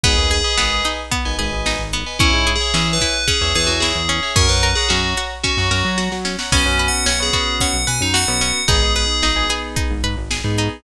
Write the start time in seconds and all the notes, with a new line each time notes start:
0.03 G#1 B3 G#4 B4 D#5 G#5, kick, closed hi-hat
0.17 D#2
0.31 G#4, closed hi-hat
0.44 B4 D#5 G#5
0.57 G#1 B3 B4 D#5 G#5, snare
0.85 D#4, snare, closed hi-hat
1.11 B3, kick, closed hi-hat
1.25 G#1 B4 D#5 G#5
1.39 G#1 G#4 B4 D#5 G#5, closed hi-hat
1.52 G#1
1.66 D#4, snare
1.79 G#1
1.93 B3, closed hi-hat
2.06 B4 D#5 G#5
2.19 E2 C#4 E4 C#5 E5 G#5, kick, closed hi-hat
2.33 G#2
2.47 G#4, closed hi-hat
2.56 G#4
2.60 C#5 E5 G#5
2.74 E3 C#4 C#5 E5 G#5, snare
2.93 B4
3.01 E4, kick, snare, closed hi-hat
3.28 C#4 G#4, kick, closed hi-hat
3.41 E2 C#5 E5 G#5
3.55 E2 G#4 B4 C#5 E5 G#5, closed hi-hat
3.67 E2 F#4
3.80 E4 G#4, snare
3.95 E2
4.09 C#4, closed hi-hat
4.23 C#5 E5 G#5
4.36 F#2 C#4 A#4 C#5 F#5 A#5, kick, closed hi-hat
4.49 F#2 B4
4.63 A#4, closed hi-hat
4.75 G#4 C#5 F#5 A#5
4.89 F#2 C#4 F#4 C#5 F#5 A#5, snare
5.17 F#4, snare, closed hi-hat
5.43 C#4 F#4, kick, snare
5.57 F#2 C#5 F#5 A#5
5.71 F#2 A#4 C#5 F#5 A#5, snare
5.85 F#3
5.98 F#4, snare
6.12 F#3, snare
6.25 C#4, snare
6.39 C#5 F#5 A#5, snare
6.52 B1 B3 C#4 F#4, kick, crash
6.66 F#2 B3 C#4 F#4
6.79 B4, closed hi-hat
6.88 F#5
7.06 B1 C#4, snare
7.20 B3 C#4 F#4 G#4
7.33 B3 C#4 F#4, kick, snare, closed hi-hat
7.60 C#4 F#5, kick, closed hi-hat
7.74 B1
7.87 B2 B4 G#5, closed hi-hat
8.01 F#2 D#4
8.14 F#4 F#5, snare
8.28 B1 B3 C#4 F#4
8.41 C#4, closed hi-hat
8.68 G#1 B3 D#4 G#4, kick, closed hi-hat
8.82 G#1 B3 D#4 G#4
8.95 G#4 B4, closed hi-hat
9.23 G#1 D#4, snare
9.36 B3 D#4 G#4
9.49 B3 D#4 G#4, snare, closed hi-hat
9.76 D#4, kick, closed hi-hat
9.90 G#1
10.04 G#2 B4, closed hi-hat
10.17 G#1
10.31 G#4, snare
10.44 G#2 B3 D#4 G#4
10.58 D#4, closed hi-hat